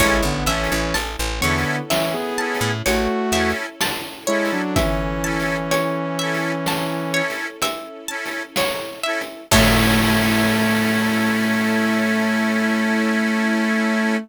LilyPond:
<<
  \new Staff \with { instrumentName = "Lead 2 (sawtooth)" } { \time 5/4 \key a \major \tempo 4 = 63 <gis e'>16 <d b>16 <e cis'>16 <e cis'>16 r8 <d b>8 <e cis'>16 <b gis'>8. <a fis'>8. r8. <gis e'>16 <fis d'>16 | <e cis'>2. r2 | a1~ a4 | }
  \new Staff \with { instrumentName = "Accordion" } { \time 5/4 \key a \major <cis' e' a'>8 <cis' e' a'>4 <cis' e' a'>4 <cis' e' a'>4 <cis' e' a'>4 <cis' e' a'>8~ | <cis' e' a'>8 <cis' e' a'>4 <cis' e' a'>4 <cis' e' a'>4 <cis' e' a'>4 <cis' e' a'>8 | <cis' e' a'>1~ <cis' e' a'>4 | }
  \new Staff \with { instrumentName = "Pizzicato Strings" } { \time 5/4 \key a \major cis''8 e''8 a''8 cis''8 e''8 a''8 cis''8 e''8 a''8 cis''8 | e''8 a''8 cis''8 e''8 a''8 cis''8 e''8 a''8 cis''8 e''8 | <cis'' e'' a''>1~ <cis'' e'' a''>4 | }
  \new Staff \with { instrumentName = "Electric Bass (finger)" } { \clef bass \time 5/4 \key a \major a,,16 a,,16 a,,16 a,,16 a,,16 a,,16 e,4~ e,16 a,16 a,,8 e,4.~ | e,1~ e,4 | a,1~ a,4 | }
  \new Staff \with { instrumentName = "String Ensemble 1" } { \time 5/4 \key a \major <cis' e' a'>1~ <cis' e' a'>4~ | <cis' e' a'>1~ <cis' e' a'>4 | <cis' e' a'>1~ <cis' e' a'>4 | }
  \new DrumStaff \with { instrumentName = "Drums" } \drummode { \time 5/4 \tuplet 3/2 { <hh bd>8 r8 hh8 hh8 r8 hh8 sn8 r8 hh8 hh8 r8 hh8 sn8 r8 hh8 } | \tuplet 3/2 { <hh bd>8 r8 hh8 hh8 r8 hh8 sn8 r8 hh8 hh8 r8 hh8 sn8 r8 hh8 } | <cymc bd>4 r4 r4 r4 r4 | }
>>